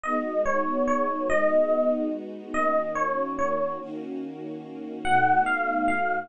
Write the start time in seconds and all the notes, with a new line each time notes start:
0.04 G#3 B3 D#4 F#4 D#5
0.46 C#5
0.88 C#5
1.30 G#3 B3 D#4 F#4 D#5
2.54 D#3 A#3 C#4 F#4 D#5
2.95 C#5
3.39 C#5
3.79 D#3 A#3 C#4 F#4
5.04 B2 A3 D#4 F#4 F#5
5.46 F5
5.88 F5